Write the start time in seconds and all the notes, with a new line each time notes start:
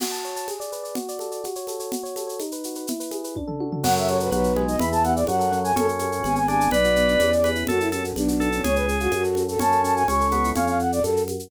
0.00 F#4, crash, low conga, shaker
0.12 A5, shaker
0.24 C#5, shaker
0.36 A5, shaker
0.48 G#4, high conga, shaker
0.60 D5, shaker
0.72 B4, shaker
0.83 D5, shaker
0.95 F#4, low conga, shaker
1.08 D5, shaker
1.19 A4, high conga, shaker
1.31 D5, shaker
1.44 F#4, high conga, shaker
1.55 C#5, shaker
1.67 A4, high conga, shaker
1.80 C#5, shaker
1.92 F#4, low conga, shaker
2.03 C#5, shaker
2.16 A4, high conga, shaker
2.27 C#5, shaker
2.40 D#4, high conga, shaker
2.52 B4, shaker
2.64 F#4, shaker
2.75 B4, shaker
2.87 E4, low conga, shaker
3.00 B4, shaker
3.11 G#4, high conga, shaker
3.24 B4, shaker
3.36 D4, kick, high tom
3.48 A4, floor tom
3.60 F#4, high tom
3.72 A4, floor tom
3.83 F#2 F#3 C#4 F#5, crash, low conga, shaker
3.96 A4 E5, shaker
4.08 C#4 C#5, high conga, shaker
4.20 F#4 B4, shaker
4.31 B1 F#3 B3 B4, high conga, shaker
4.44 F#4, shaker
4.56 G#3 B3, high conga
4.68 D#4 D#5, shaker
4.79 E2 E3 B3 B5, low conga, shaker
4.92 G#4 A5, shaker
5.03 B3 F#5, high conga, shaker
5.15 E4 D5, shaker
5.27 F#2 F#3 C#4 F#5, high conga, shaker
5.39 A4, shaker
5.52 F#3 C#4, shaker
5.64 F#4 G#5, shaker
5.76 F#2 C#4 A4, low conga, shaker
5.87 A4, shaker
5.99 C#4, high conga, shaker
6.12 F#4, shaker
6.23 G#1 B3 G#5, high conga, shaker
6.36 G#4 G#5, shaker
6.47 B3 D4 G#5, high conga, shaker
6.60 D4, shaker
6.71 B1 B3 B4 D5, low conga, shaker
6.84 F#4, shaker
6.96 B3, shaker
7.08 D4, shaker
7.19 E2 C#4, high conga, shaker
7.32 G#4, shaker
7.44 C#4 B4, high conga, shaker
7.55 E4, shaker
7.67 F#2 C#4 F#4 A4, low conga, shaker
7.79 E4 A4, shaker
7.92 C#4 A4, high conga, shaker
8.03 C#4 F#4, shaker
8.15 B1 B3 D4, high conga, shaker
8.28 F#4, shaker
8.40 B3 A4, shaker
8.52 C#4 D4, shaker
8.64 C#2 C#4 G#4 C#5, low conga, shaker
8.76 G#4 B4, shaker
8.87 C#4 G#4, shaker
9.00 F4 F#4, shaker
9.11 F#2 C#4 F#4, high conga, shaker
9.23 A4, shaker
9.35 C#4, high conga, shaker
9.48 F#4 A4, shaker
9.59 F#2 C#4 A5, low conga, shaker
9.72 A4, shaker
9.84 C#4 A5, shaker
9.96 F#4 G#5, shaker
10.08 C#2 C#4 C#6, high conga, shaker
10.20 A4, shaker
10.31 B3 C#4, high conga, shaker
10.44 E4, shaker
10.55 F2 C#4 F5, low conga, shaker
10.67 F5, shaker
10.79 F#5, shaker
10.92 D5, shaker
11.02 F#2 A4, high conga, shaker
11.17 shaker
11.28 high conga, shaker
11.39 shaker